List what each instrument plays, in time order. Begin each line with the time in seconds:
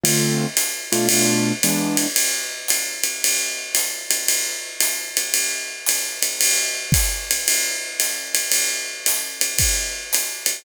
0.04 acoustic grand piano D3 A3 C4 F4, ride
0.57 hi-hat pedal, ride
0.92 acoustic grand piano B2 A3 D4 F4, ride
1.09 ride
1.63 acoustic grand piano E3 G#3 B3 D4, hi-hat pedal, ride
1.97 ride
2.16 ride
2.68 hi-hat pedal, ride
3.04 ride
3.24 ride
3.75 hi-hat pedal, ride
4.11 ride
4.28 ride
4.80 hi-hat pedal, ride
5.17 ride
5.34 ride
5.86 hi-hat pedal, ride
6.22 ride
6.41 ride
6.92 kick, hi-hat pedal, ride
7.31 ride
7.48 ride
8.00 hi-hat pedal, ride
8.35 ride
8.52 ride
9.06 hi-hat pedal, ride
9.41 ride
9.59 kick, ride
10.13 hi-hat pedal, ride
10.46 ride